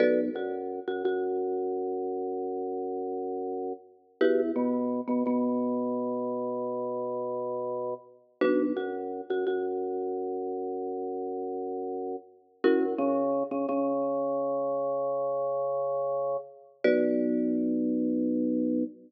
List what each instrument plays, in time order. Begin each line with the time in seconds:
0.00 drawbar organ B1, marimba F#4 A4 B4 D5
0.35 drawbar organ F#2, marimba F#4
0.87 drawbar organ F#2, marimba F#4
1.04 drawbar organ F#2, marimba F#4
4.21 drawbar organ E2, marimba E4 F#4 G4 B4
4.56 drawbar organ B2, marimba B3
5.08 drawbar organ B2, marimba B3
5.26 drawbar organ B2, marimba B3
8.41 drawbar organ B1, marimba D4 F#4 B4
8.76 drawbar organ F#2, marimba F#4
9.30 drawbar organ F#2, marimba F#4
9.47 drawbar organ F#2, marimba F#4
12.64 drawbar organ F#2, marimba C#4 E4 F#4 A#4
12.98 drawbar organ C#3, marimba C#4
13.51 drawbar organ C#3, marimba C#4
13.68 drawbar organ C#3, marimba C#4
16.84 drawbar organ B1, marimba F#4 B4 D5